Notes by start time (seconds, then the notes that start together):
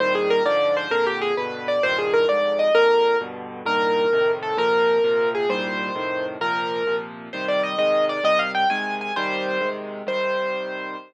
0.00 C2 A#2 D#3 G3 C5
0.15 G#4
0.30 A#4
0.45 G#2 D3 F3 D5
0.77 C5
0.91 F2 A#2 D3 A#4
1.07 G4
1.22 G#4
1.37 G2 B2 D3 B4
1.68 D5
1.83 C2 G2 A#2 D#3 C5
1.98 G#4
2.13 A#4
2.28 D2 F2 G#2 D5
2.59 D#5
2.75 A#1 F2 D3 A#4
3.21 G2 B2 D3
3.65 C2 G2 A#2 D#3 A#4
4.13 F2 A2 C3 D#3
4.43 A4
4.57 A#2 C3 F3 A#4
5.04 A#2 C3 F3
5.35 G#4
5.49 C2 A#2 D#3 G3 C5
5.95 F2 A2 C3 D#3
6.41 A#2 C3 F3 A#4
6.87 A#2 C3 F3
7.33 C3 D#3 G3 C5
7.48 D5
7.63 D#5
7.78 C3 D#3 G#3 D#5
8.09 D5
8.24 C3 D#3 G3 D#5
8.39 F5
8.55 G5
8.70 C3 D#3 G#3 G#5
9.01 G#5
9.16 C3 D#3 G3 C5
9.61 C3 D#3 G#3
10.07 C3 D#3 G3 C5